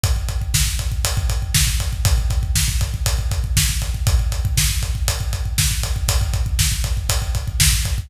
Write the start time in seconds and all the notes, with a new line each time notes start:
0.03 kick, closed hi-hat
0.16 kick
0.28 kick, closed hi-hat
0.41 kick
0.54 kick, snare
0.67 kick
0.79 kick, closed hi-hat
0.92 kick
1.04 kick, closed hi-hat
1.17 kick
1.29 kick, closed hi-hat
1.42 kick
1.54 kick, snare
1.67 kick
1.80 kick, closed hi-hat
1.93 kick
2.05 kick, closed hi-hat
2.18 kick
2.30 kick, closed hi-hat
2.43 kick
2.55 kick, snare
2.68 kick
2.81 kick, closed hi-hat
2.94 kick
3.06 kick, closed hi-hat
3.18 kick
3.31 kick, closed hi-hat
3.44 kick
3.57 kick, snare
3.69 kick
3.82 kick, closed hi-hat
3.94 kick
4.07 kick, closed hi-hat
4.19 kick
4.32 kick, closed hi-hat
4.45 kick
4.57 kick, snare
4.70 kick
4.82 kick, closed hi-hat
4.95 kick
5.08 kick, closed hi-hat
5.20 kick
5.33 kick, closed hi-hat
5.45 kick
5.58 kick, snare
5.71 kick
5.83 kick, closed hi-hat
5.96 kick
6.08 kick, closed hi-hat
6.21 kick
6.34 kick, closed hi-hat
6.46 kick
6.59 kick, snare
6.72 kick
6.84 kick, closed hi-hat
6.97 kick
7.09 kick, closed hi-hat
7.22 kick
7.35 kick, closed hi-hat
7.47 kick
7.60 kick, snare
7.72 kick
7.85 kick, closed hi-hat
7.98 kick